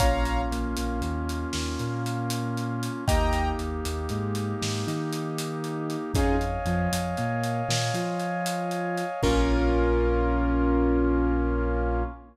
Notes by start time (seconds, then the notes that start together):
0.00 A#1 A#3 C#4 F4 C#5 F5 A#5, kick, closed hi-hat
0.25 closed hi-hat
0.51 A#1 A#3, closed hi-hat
0.77 A#1 A#3, closed hi-hat
1.01 D#2 D#3, closed hi-hat
1.29 closed hi-hat
1.53 D#2 D#3, snare
1.79 A#2 A#3, closed hi-hat
2.06 closed hi-hat
2.30 closed hi-hat
2.57 closed hi-hat
2.83 closed hi-hat
3.07 D#2 A#3 D#4 G4 D#5 G5 A#5, kick, closed hi-hat
3.33 closed hi-hat
3.59 D#2 D#3, closed hi-hat
3.85 D#2 D#3, closed hi-hat
4.09 G#2 G#3, closed hi-hat
4.35 closed hi-hat
4.61 G#2 G#3, snare
4.87 D#3 D#4, closed hi-hat
5.13 closed hi-hat
5.38 closed hi-hat
5.64 closed hi-hat
5.90 closed hi-hat
6.14 F2 C#4 D#4 F4 G#4 C#5 D#5 F5 G#5, kick, closed hi-hat
6.41 closed hi-hat
6.65 F2 F3, closed hi-hat
6.92 F2 F3, closed hi-hat
7.17 A#2 A#3, closed hi-hat
7.44 closed hi-hat
7.69 A#2 A#3, snare
7.94 F3 F4, closed hi-hat
8.20 closed hi-hat
8.46 closed hi-hat
8.71 closed hi-hat
8.98 closed hi-hat
9.23 A#1 A#3 C#4 F4 A#4, kick, crash